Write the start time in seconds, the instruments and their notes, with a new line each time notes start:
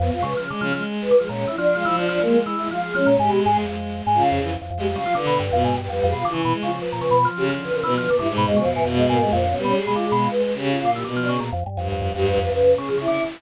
0.00 drawbar organ F2, choir aahs B3
0.12 drawbar organ F2, choir aahs F4
0.18 violin G#3
0.23 drawbar organ C#3, choir aahs B4
0.37 violin C#3, drawbar organ F3
0.49 drawbar organ D3, violin G#3
0.61 violin C#3, drawbar organ F3
0.74 drawbar organ F3, violin G#3
1.01 choir aahs B4
1.11 drawbar organ D3
1.19 drawbar organ F3, violin G#3, choir aahs G#4
1.29 drawbar organ A#2, choir aahs C#4
1.47 drawbar organ E3, choir aahs E4
1.57 drawbar organ F3, choir aahs D4
1.75 drawbar organ F3, violin G#3, choir aahs F4
1.84 drawbar organ E3, violin F3, choir aahs F4
1.96 drawbar organ F3, choir aahs D4
2.09 drawbar organ F3, choir aahs D4
2.21 drawbar organ F3, violin G#3, choir aahs A#3
2.46 drawbar organ E3
2.58 violin G#3, choir aahs E4
2.68 drawbar organ F3, violin G#3, choir aahs F4
2.82 choir aahs G#4
2.94 drawbar organ F3, violin G#3, choir aahs C#4
3.07 drawbar organ A#2
3.13 violin G#3
3.19 drawbar organ G#2, violin G#3, choir aahs G4
3.29 drawbar organ B2
3.44 drawbar organ G#2, choir aahs G#4
3.57 drawbar organ F2
3.68 drawbar organ F2, violin G#3
4.05 drawbar organ G#2, violin G#3
4.14 violin C#3, choir aahs F4
4.32 drawbar organ F2, choir aahs G#4
4.40 drawbar organ F2, violin E3
4.62 drawbar organ F2
4.70 drawbar organ F2
4.77 drawbar organ F2, violin G#3, choir aahs G4
4.88 violin G3
4.96 drawbar organ C#3, violin F3, choir aahs F4
5.06 drawbar organ F3
5.15 violin D3, drawbar organ D3, choir aahs B4
5.27 drawbar organ B2
5.40 drawbar organ G2
5.52 drawbar organ F2, violin B2
5.65 drawbar organ G#2
5.70 choir aahs B4
5.78 drawbar organ G2, choir aahs B4
5.89 drawbar organ F2, violin G3, choir aahs B4
6.03 drawbar organ F2
6.07 choir aahs G#4
6.12 drawbar organ B2
6.17 choir aahs F4
6.25 drawbar organ D3, violin E3
6.34 drawbar organ C#3
6.45 drawbar organ B2
6.54 violin G#3
6.63 drawbar organ C#3, violin F3, choir aahs F4
6.81 choir aahs B4
6.92 drawbar organ A#2
6.99 drawbar organ C#3, choir aahs B4
7.11 drawbar organ B2
7.18 choir aahs B4
7.25 drawbar organ F3
7.36 violin C#3, choir aahs G4
7.54 violin D3, drawbar organ F3
7.64 choir aahs B4
7.72 violin C#3, drawbar organ F3, choir aahs A#4
7.82 violin B2, drawbar organ E3, choir aahs B4
7.91 choir aahs B4
7.97 violin D3, drawbar organ F3
8.09 violin A#2, drawbar organ D3
8.19 violin G2, drawbar organ D3, choir aahs E4
8.28 violin G#2
8.37 drawbar organ B2
8.46 drawbar organ F2, violin B2, choir aahs G#3
8.56 drawbar organ C#3, choir aahs F3
8.65 drawbar organ F2
8.71 choir aahs E3
8.76 drawbar organ G#2
8.83 drawbar organ F2, violin B2, choir aahs E3
8.96 choir aahs G#3
9.08 drawbar organ G#2, choir aahs A#3
9.20 violin G2, choir aahs G#3
9.29 drawbar organ F2, violin A#2, choir aahs F3
9.39 violin D3
9.45 violin B2, choir aahs C#4
9.57 violin G3, choir aahs B3
9.64 drawbar organ B2, choir aahs C#4
9.75 choir aahs G#4
9.82 violin G#3
9.87 drawbar organ B2
9.94 drawbar organ D3, choir aahs F4
10.06 violin G#3, choir aahs G#4
10.12 drawbar organ B2
10.18 choir aahs F4
10.30 violin G#3, choir aahs B4
10.43 choir aahs B4
10.54 violin C#3, choir aahs G4
10.67 choir aahs F4
10.80 violin A#2, choir aahs F4
10.85 drawbar organ D3
10.92 drawbar organ E3, choir aahs G4
11.04 violin B2, drawbar organ D3
11.16 drawbar organ F3
11.23 choir aahs D4
11.29 drawbar organ C#3, choir aahs G#4
11.40 drawbar organ A#2
11.53 drawbar organ F2
11.66 drawbar organ G2
11.77 drawbar organ F2, violin G2
11.92 drawbar organ F2
12.02 drawbar organ F2
12.13 drawbar organ F2, violin G2, choir aahs G4
12.27 drawbar organ F2, choir aahs B4
12.39 drawbar organ F2, choir aahs B4
12.52 drawbar organ F2, violin C#3, choir aahs B4
12.64 drawbar organ F2
12.76 drawbar organ C#3, choir aahs G#4
12.89 drawbar organ F3
12.98 drawbar organ C#3, choir aahs E4
13.08 drawbar organ D3